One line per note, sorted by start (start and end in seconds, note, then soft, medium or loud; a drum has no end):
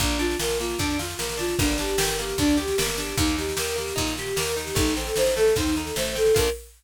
0.00 0.36 A#1 loud
0.00 0.18 A#3 loud
0.00 0.18 D4 medium
0.00 kick loud
0.00 snare medium
0.10 snare medium
0.19 0.37 D4 loud
0.19 0.38 F4 medium
0.19 snare medium
0.31 snare medium
0.39 0.75 A#1 medium
0.39 0.58 F4 medium
0.39 0.58 A#4 medium
0.39 snare loud
0.49 snare medium
0.60 0.78 A#3 loud
0.60 0.78 F4 medium
0.60 snare medium
0.70 snare medium
0.79 1.15 F2 medium
0.79 0.97 D4 loud
0.79 0.98 D4 medium
0.79 kick medium
0.79 snare medium
0.90 snare medium
0.99 1.17 F4 medium
0.99 1.18 F4 medium
0.99 snare loud
1.10 snare medium
1.19 1.55 A#1 medium
1.19 1.37 A#3 medium
1.19 1.38 A#4 medium
1.19 snare loud
1.29 snare medium
1.37 1.55 D4 medium
1.37 1.57 F4 medium
1.37 snare medium
1.48 snare medium
1.59 1.95 G1 loud
1.59 1.77 A#3 loud
1.59 1.77 D4 medium
1.59 kick loud
1.59 snare medium
1.69 snare medium
1.78 1.97 D4 medium
1.78 1.97 G4 medium
1.78 snare loud
1.88 snare medium
1.98 2.34 G1 medium
1.98 2.16 G4 medium
1.98 2.17 A#4 medium
1.98 snare loud
2.08 snare medium
2.19 2.37 A#3 medium
2.19 2.37 G4 medium
2.19 snare medium
2.29 snare medium
2.38 2.74 D2 medium
2.38 2.57 D4 medium
2.38 2.57 D4 loud
2.38 kick loud
2.38 snare medium
2.48 snare medium
2.57 2.75 G4 medium
2.57 2.77 G4 medium
2.57 snare medium
2.68 snare medium
2.78 3.14 G1 medium
2.78 2.96 A#3 medium
2.78 2.96 A#4 medium
2.78 snare loud
2.88 snare medium
2.98 3.16 D4 loud
2.98 3.16 G4 medium
2.98 snare medium
3.08 snare medium
3.17 3.53 D#2 loud
3.17 3.36 A#3 loud
3.17 3.36 D#4 medium
3.17 kick loud
3.17 snare medium
3.27 snare medium
3.38 3.56 D#4 medium
3.38 3.56 G4 medium
3.38 snare medium
3.49 snare medium
3.57 3.93 D#2 medium
3.57 3.74 G4 loud
3.57 3.76 A#4 medium
3.57 snare loud
3.68 snare medium
3.76 3.94 A#3 medium
3.76 3.96 G4 medium
3.76 snare medium
3.88 snare medium
3.96 4.34 A#2 loud
3.96 4.14 D#4 loud
3.96 4.16 D#4 medium
3.96 kick loud
3.96 snare medium
4.07 snare medium
4.17 4.36 G4 medium
4.17 4.37 G4 medium
4.17 snare medium
4.26 snare medium
4.36 4.73 D#2 medium
4.36 4.54 A#3 medium
4.36 4.55 A#4 medium
4.36 snare loud
4.46 snare medium
4.56 4.74 D#4 medium
4.56 4.75 G4 medium
4.56 snare medium
4.67 snare medium
4.75 5.12 A1 loud
4.75 4.93 A3 loud
4.75 4.95 D#4 medium
4.75 kick loud
4.75 snare loud
4.87 snare medium
4.97 5.14 C4 loud
4.97 5.15 A4 medium
4.97 snare medium
5.07 snare medium
5.16 5.52 A1 medium
5.16 5.34 D#4 loud
5.16 5.35 C5 medium
5.16 snare loud
5.26 snare medium
5.36 5.54 A3 loud
5.36 5.55 A4 medium
5.36 snare medium
5.47 snare medium
5.56 5.92 D#2 medium
5.56 5.75 C4 loud
5.56 5.75 D#4 medium
5.56 kick loud
5.56 snare medium
5.67 snare medium
5.76 5.95 D#4 medium
5.76 5.94 A4 medium
5.76 snare medium
5.87 snare medium
5.96 6.32 A1 medium
5.96 6.15 A3 medium
5.96 6.14 C5 medium
5.96 snare loud
6.05 snare medium
6.15 6.33 C4 medium
6.15 6.34 A4 medium
6.15 snare medium
6.26 snare medium
6.35 6.50 A#1 loud
6.35 6.48 D4 medium
6.35 6.48 F4 loud
6.35 6.50 A#4 loud
6.35 kick loud
6.35 crash loud
6.40 6.48 A#3 loud